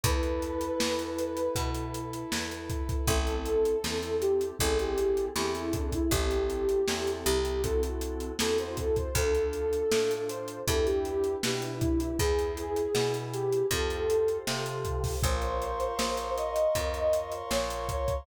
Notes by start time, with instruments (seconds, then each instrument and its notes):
0.03 electric bass (finger) E2, electric piano 2 E4 A4 B4, pad 2 (warm) E4 A4 B4, ocarina B4, kick, closed hi-hat
0.23 closed hi-hat
0.42 closed hi-hat
0.61 closed hi-hat
0.80 electric bass (finger) E2, snare
0.99 closed hi-hat
1.19 closed hi-hat
1.37 closed hi-hat
1.55 electric bass (finger) B2, electric piano 2 E4 A4 B4, kick, closed hi-hat
1.75 closed hi-hat
1.94 closed hi-hat
2.13 closed hi-hat
2.32 electric bass (finger) E2, snare
2.51 closed hi-hat
2.70 kick, closed hi-hat
2.89 kick, closed hi-hat
3.07 electric bass (finger) A1, electric piano 2 C4 E4 A4, ocarina A4, kick, closed hi-hat
3.27 closed hi-hat
3.46 closed hi-hat
3.65 closed hi-hat
3.84 electric bass (finger) E2, electric piano 2 C4 E4 A4, snare
4.03 closed hi-hat
4.21 ocarina G4, closed hi-hat
4.41 closed hi-hat
4.59 electric bass (finger) A1, electric piano 2 C4 E4 G#4 A4, ocarina A4, kick, closed hi-hat
4.79 ocarina G4, closed hi-hat
4.98 closed hi-hat
5.17 closed hi-hat
5.35 electric bass (finger) E2, electric piano 2 C4 E4 G#4 A4, ocarina G4, snare
5.54 ocarina E4, closed hi-hat
5.73 ocarina D4, kick, closed hi-hat
5.92 ocarina E4, kick, closed hi-hat
6.10 electric bass (finger) A1, electric piano 2 C4 E4 G4 A4, ocarina G4, kick, closed hi-hat
6.31 closed hi-hat
6.50 closed hi-hat
6.69 closed hi-hat
6.88 electric bass (finger) E2, electric piano 2 C4 E4 G4 A4, snare
7.07 closed hi-hat
7.25 electric bass (finger) C2, ocarina G4, closed hi-hat
7.45 closed hi-hat
7.63 electric piano 2 C4 E4 F#4 A4, ocarina A4, kick, closed hi-hat
7.83 closed hi-hat
8.01 closed hi-hat
8.20 closed hi-hat
8.39 electric bass (finger) E2, electric piano 2 C4 E4 F#4 A4, ocarina A4, snare
8.58 ocarina C5, closed hi-hat
8.77 ocarina A4, kick, closed hi-hat
8.96 ocarina C5, kick, closed hi-hat
9.15 electric bass (finger) D2, electric piano 2 D4 F4 A4, ocarina A4, kick, closed hi-hat
9.35 closed hi-hat
9.53 closed hi-hat
9.73 closed hi-hat
9.91 electric bass (finger) A2, electric piano 2 D4 F4 A4, snare
10.11 closed hi-hat
10.28 ocarina C5, closed hi-hat
10.48 closed hi-hat
10.67 electric bass (finger) E2, electric piano 2 D4 E4 G4 B4, ocarina A4, kick, closed hi-hat
10.86 ocarina G4, closed hi-hat
11.05 closed hi-hat
11.24 closed hi-hat
11.43 electric bass (finger) B2, electric piano 2 D4 E4 G4 B4, ocarina G4, snare
11.62 ocarina E4, closed hi-hat
11.81 ocarina E4, kick, closed hi-hat
12.00 ocarina E4, closed hi-hat
12.19 electric bass (finger) E2, electric piano 2 E4 G#4 B4, ocarina G#4, kick, closed hi-hat
12.39 closed hi-hat
12.57 closed hi-hat
12.76 closed hi-hat
12.95 electric bass (finger) B2, electric piano 2 E4 G#4 B4, snare
13.14 closed hi-hat
13.33 ocarina G4, closed hi-hat
13.53 closed hi-hat
13.71 electric bass (finger) F2, electric piano 2 F4 G4 A4 C5, ocarina A4, kick, closed hi-hat
13.90 closed hi-hat
14.10 closed hi-hat
14.28 closed hi-hat
14.47 electric bass (finger) C3, electric piano 2 F4 G4 A4 C5, snare
14.66 closed hi-hat
14.85 kick, closed hi-hat
15.04 kick, open hi-hat
15.23 electric bass (finger) A#1, electric piano 2 F4 A#4 C5 C#5, ocarina C5, pad 2 (warm) F5 A#5 C6 C#6, kick, closed hi-hat
15.42 closed hi-hat
15.62 closed hi-hat
15.80 closed hi-hat
15.99 electric bass (finger) A#1, snare
16.17 closed hi-hat
16.37 ocarina D#5, closed hi-hat
16.56 closed hi-hat
16.75 electric bass (finger) F2, electric piano 2 F4 A#4 C5 C#5, kick, closed hi-hat
16.94 closed hi-hat
17.13 closed hi-hat
17.32 closed hi-hat
17.51 electric bass (finger) A#1, ocarina C#5, snare
17.70 closed hi-hat
17.89 kick, closed hi-hat
18.08 kick, closed hi-hat